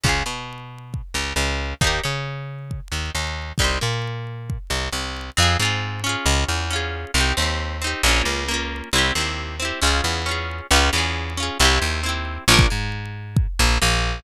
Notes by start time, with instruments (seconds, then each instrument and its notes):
0.04 electric bass (finger) C#2, acoustic guitar (steel) C#4 F4, kick
0.09 acoustic guitar (steel) G#4
0.26 electric bass (finger) B2, acoustic guitar (steel) B3
0.94 kick
1.14 electric bass (finger) C#2, acoustic guitar (steel) C#3
1.36 electric bass (finger) C#2, acoustic guitar (steel) C#3
1.81 electric bass (finger) D#2, acoustic guitar (steel) D#4 G4, kick
1.87 acoustic guitar (steel) A#4
2.04 electric bass (finger) C#3, acoustic guitar (steel) C#4
2.71 kick
2.92 electric bass (finger) D#2, acoustic guitar (steel) D#3
3.15 electric bass (finger) D#2, acoustic guitar (steel) D#3
3.58 electric bass (finger) C2, acoustic guitar (steel) D#4 G4, kick
3.64 acoustic guitar (steel) C5
3.81 electric bass (finger) A#2, acoustic guitar (steel) A#3
4.50 kick
4.70 electric bass (finger) C2, acoustic guitar (steel) C3
4.92 electric bass (finger) C2, acoustic guitar (steel) C3
5.37 electric bass (finger) F2, acoustic guitar (steel) C4 F4
5.42 acoustic guitar (steel) G#4
5.60 electric bass (finger) G#2, acoustic guitar (steel) C4 F4
5.65 acoustic guitar (steel) G#4
6.04 acoustic guitar (steel) C#4 F4
6.09 acoustic guitar (steel) G#4
6.26 electric bass (finger) C#2
6.48 electric bass (finger) E2
6.70 acoustic guitar (steel) C#4 F4
6.76 acoustic guitar (steel) G#4
7.14 electric bass (finger) C2, acoustic guitar (steel) C4 D#4
7.20 acoustic guitar (steel) G4
7.37 electric bass (finger) D#2, acoustic guitar (steel) C4 D#4
7.42 acoustic guitar (steel) G4
7.82 acoustic guitar (steel) C4 D#4
7.87 acoustic guitar (steel) G4
8.03 electric bass (finger) A#1, acoustic guitar (steel) A#3 C#4
8.09 acoustic guitar (steel) F4
8.25 electric bass (finger) C#2
8.48 acoustic guitar (steel) A#3 C#4
8.54 acoustic guitar (steel) F4
8.93 electric bass (finger) C2, acoustic guitar (steel) C4 E4
8.98 acoustic guitar (steel) G4
9.15 electric bass (finger) D#2, acoustic guitar (steel) C4 E4
9.21 acoustic guitar (steel) G4
9.60 acoustic guitar (steel) C4 E4
9.65 acoustic guitar (steel) G4
9.82 electric bass (finger) C#2, acoustic guitar (steel) C#4 F4
9.87 acoustic guitar (steel) G#4
10.04 electric bass (finger) E2
10.26 acoustic guitar (steel) C#4 F4
10.31 acoustic guitar (steel) G#4
10.71 electric bass (finger) C#2, acoustic guitar (steel) C#4 F4
10.76 acoustic guitar (steel) G#4
10.93 electric bass (finger) E2, acoustic guitar (steel) C#4 F4
10.98 acoustic guitar (steel) G#4
11.37 acoustic guitar (steel) C#4 F4
11.43 acoustic guitar (steel) G#4
11.60 electric bass (finger) C2, acoustic guitar (steel) C4 E4
11.65 acoustic guitar (steel) G4
11.82 electric bass (finger) D#2
12.03 acoustic guitar (steel) C4 E4
12.09 acoustic guitar (steel) G4
12.48 electric bass (finger) A#1, acoustic guitar (steel) D4 F4
12.54 acoustic guitar (steel) A#4
12.59 kick
12.70 electric bass (finger) G#2, acoustic guitar (steel) G#3
13.37 kick
13.59 electric bass (finger) A#1, acoustic guitar (steel) A#3
13.82 electric bass (finger) A#1, acoustic guitar (steel) A#3